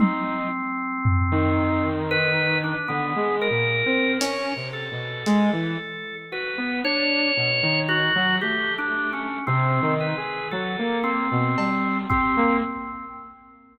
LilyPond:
<<
  \new Staff \with { instrumentName = "Drawbar Organ" } { \time 6/4 \tempo 4 = 57 c'2 b'8 d'16 b8 ais'8. cis''8 a'4. | b'8 cis''4 fis'8 \tuplet 3/2 { g'8 d'8 cis'8 } c'8 b'8 a'8 c'4 c'8 | }
  \new Staff \with { instrumentName = "Lead 2 (sawtooth)" } { \time 6/4 dis'8 r8. dis4. d16 \tuplet 3/2 { gis8 ais,8 c'8 cis'8 c8 b,8 } gis16 e16 r8 | fis'16 b16 d'8 b,16 dis8 fis16 a4 \tuplet 3/2 { c8 dis8 gis'8 } fis16 ais8 b,16 g8 g'16 ais16 | }
  \new DrumStaff \with { instrumentName = "Drums" } \drummode { \time 6/4 tommh4 tomfh4 r4 r4 hh4 hh4 | r4 r4 r4 r4 r4 cb8 bd8 | }
>>